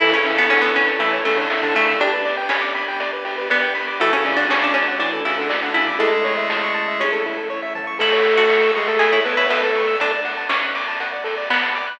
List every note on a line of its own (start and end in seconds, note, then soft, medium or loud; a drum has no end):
0.00 1.84 A1 loud
0.00 0.13 E3 loud
0.00 1.98 C#4 medium
0.00 0.12 E4 medium
0.00 1.98 E4 medium
0.00 0.13 E4 loud
0.00 0.11 A4 loud
0.00 1.98 A4 medium
0.00 kick loud
0.00 crash medium
0.12 0.24 C#3 medium
0.12 0.24 C#4 medium
0.12 0.37 C#4 medium
0.12 0.23 C#5 medium
0.25 0.48 C#3 medium
0.25 0.48 C#4 medium
0.25 0.37 E5 medium
0.25 open hi-hat medium
0.37 0.50 B3 medium
0.37 0.48 A5 medium
0.49 0.72 D3 medium
0.49 0.62 C#4 medium
0.49 0.72 D4 medium
0.49 0.61 C#6 medium
0.49 kick medium
0.49 clap medium
0.62 0.74 B3 medium
0.62 0.75 E6 medium
0.75 0.99 C#4 medium
0.75 0.86 C#6 medium
0.75 open hi-hat medium
0.88 0.99 A5 medium
0.99 1.19 E3 medium
0.99 1.20 A3 medium
0.99 1.19 E4 loud
0.99 1.12 E5 medium
0.99 kick medium
0.99 closed hi-hat medium
1.13 1.24 C#5 medium
1.25 1.38 C#3 medium
1.25 1.74 A3 medium
1.25 1.38 C#4 medium
1.25 1.36 A4 medium
1.25 open hi-hat medium
1.37 1.49 D3 medium
1.37 1.49 D4 loud
1.37 1.49 C#5 medium
1.50 1.61 E5 medium
1.50 kick medium
1.50 snare medium
1.62 1.74 D3 loud
1.62 1.74 D4 loud
1.62 1.74 A5 medium
1.74 1.97 C#3 medium
1.74 1.96 A3 medium
1.74 1.97 C#4 medium
1.74 1.87 C#6 medium
1.74 open hi-hat medium
1.88 2.00 E6 medium
1.98 3.84 G1 loud
1.98 3.96 B3 medium
1.98 3.96 D4 medium
1.98 2.46 D4 medium
1.98 3.96 G4 medium
1.98 2.12 G4 loud
1.98 kick medium
1.98 closed hi-hat medium
2.13 2.24 B4 medium
2.25 2.36 D5 medium
2.25 open hi-hat medium
2.37 2.49 G5 medium
2.49 3.39 C#4 medium
2.49 2.61 B5 medium
2.49 kick medium
2.49 snare loud
2.62 2.73 D6 medium
2.75 2.86 B5 medium
2.75 open hi-hat medium
2.88 2.99 G5 medium
3.00 3.11 D5 medium
3.00 kick medium
3.00 closed hi-hat medium
3.13 3.24 B4 medium
3.25 3.36 G4 medium
3.25 open hi-hat medium
3.38 3.49 B4 medium
3.50 3.96 B3 medium
3.50 3.61 D5 medium
3.50 kick medium
3.50 snare medium
3.62 3.73 G5 medium
3.75 3.86 B5 loud
3.75 open hi-hat medium
3.88 3.99 D6 medium
3.99 5.83 D2 loud
3.99 4.12 E3 medium
3.99 5.98 A3 medium
3.99 4.13 A3 medium
3.99 5.98 D4 medium
3.99 4.12 E4 loud
3.99 4.11 F#4 loud
3.99 5.98 F#4 medium
3.99 kick medium
3.99 closed hi-hat medium
4.12 4.24 C#3 medium
4.12 4.24 C#4 loud
4.12 4.33 C#4 medium
4.12 4.24 A4 medium
4.25 4.45 C#3 medium
4.25 4.45 C#4 loud
4.25 4.37 D5 medium
4.25 open hi-hat medium
4.36 4.48 D4 medium
4.36 4.49 F#5 medium
4.49 4.72 C#3 medium
4.49 4.72 C#4 loud
4.49 4.62 C#4 medium
4.49 4.61 A5 medium
4.49 kick medium
4.49 snare loud
4.61 4.76 D4 medium
4.61 4.73 D6 medium
4.74 4.96 C#4 medium
4.74 4.86 A5 medium
4.74 open hi-hat medium
4.88 4.99 F#5 medium
4.99 5.21 E3 medium
4.99 5.24 D4 medium
4.99 5.21 E4 medium
4.99 5.11 D5 medium
4.99 kick medium
4.99 closed hi-hat medium
5.13 5.24 A4 medium
5.25 5.38 C#3 medium
5.25 5.38 C#4 medium
5.25 5.71 E4 medium
5.25 5.37 F#4 medium
5.25 open hi-hat medium
5.38 5.51 D3 medium
5.38 5.51 D4 medium
5.38 5.49 A4 medium
5.49 5.61 D5 medium
5.49 kick medium
5.49 snare loud
5.62 5.74 D3 medium
5.62 5.74 D4 loud
5.62 5.74 F#5 medium
5.74 5.96 C#3 medium
5.74 5.96 C#4 medium
5.74 5.98 E4 medium
5.74 5.86 A5 medium
5.74 open hi-hat medium
5.87 5.98 D6 medium
5.99 7.85 A1 loud
5.99 7.04 G#3 loud
5.99 7.98 A3 medium
5.99 7.98 C#4 medium
5.99 6.11 E4 loud
5.99 7.98 E4 medium
5.99 7.04 G#4 loud
5.99 6.86 A4 medium
5.99 kick medium
5.99 closed hi-hat medium
6.12 6.24 A4 medium
6.24 6.35 C#5 loud
6.24 open hi-hat medium
6.37 6.49 E5 medium
6.49 6.61 A5 medium
6.49 kick medium
6.49 snare medium
6.63 6.74 C#6 medium
6.74 6.86 A5 medium
6.88 6.99 E5 medium
7.00 7.47 C#4 medium
7.00 7.11 C#5 medium
7.00 kick medium
7.00 open hi-hat medium
7.00 high tom medium
7.13 7.24 A4 medium
7.25 7.37 E4 medium
7.25 floor tom medium
7.37 7.48 A4 medium
7.50 7.61 C#5 medium
7.62 7.74 E5 medium
7.75 7.86 A5 medium
7.75 floor tom loud
7.87 7.98 C#6 medium
7.99 9.84 A1 loud
7.99 8.71 A3 loud
7.99 8.25 E4 medium
7.99 8.10 A4 loud
7.99 8.71 A4 loud
7.99 kick medium
7.99 crash loud
8.12 8.24 C#5 medium
8.24 8.36 E5 medium
8.24 open hi-hat medium
8.38 8.95 F#4 medium
8.38 8.49 A5 medium
8.50 8.61 C#6 medium
8.50 kick medium
8.50 snare medium
8.62 8.74 E6 medium
8.75 8.88 G#3 medium
8.75 8.88 G#4 loud
8.75 8.87 C#6 medium
8.75 open hi-hat medium
8.87 9.21 A3 medium
8.87 9.21 A4 loud
8.87 9.00 A5 medium
8.99 9.11 G#4 medium
8.99 9.12 E5 medium
8.99 kick medium
8.99 closed hi-hat loud
9.12 9.24 E4 medium
9.12 9.24 C#5 medium
9.25 9.47 B3 medium
9.25 9.36 A4 medium
9.25 9.47 B4 loud
9.25 open hi-hat medium
9.37 9.49 E4 medium
9.37 9.49 C#5 medium
9.49 9.94 A3 medium
9.49 9.61 B3 medium
9.49 9.61 B4 loud
9.49 9.61 E5 medium
9.49 kick medium
9.49 snare loud
9.62 9.96 A3 medium
9.62 9.96 A4 medium
9.62 9.75 A5 medium
9.75 9.87 C#6 medium
9.75 open hi-hat medium
9.88 9.99 E6 medium
10.00 11.84 D2 medium
10.00 10.46 D4 medium
10.00 10.12 A4 loud
10.00 kick loud
10.00 closed hi-hat loud
10.12 10.23 D5 medium
10.25 10.36 F#5 medium
10.25 open hi-hat medium
10.37 10.48 A5 medium
10.49 11.39 C#4 medium
10.49 10.61 D6 medium
10.49 kick medium
10.49 snare loud
10.63 10.74 F#6 medium
10.75 10.86 D6 medium
10.75 open hi-hat medium
10.88 10.99 A5 medium
11.00 11.12 F#5 medium
11.00 kick medium
11.00 closed hi-hat medium
11.13 11.24 D5 medium
11.24 11.35 A4 medium
11.24 open hi-hat medium
11.38 11.49 D5 medium
11.50 11.95 B3 medium
11.50 11.62 F#5 medium
11.50 kick medium
11.50 clap loud
11.62 11.74 A5 medium
11.75 11.86 D6 medium
11.75 open hi-hat medium
11.87 11.98 F#6 medium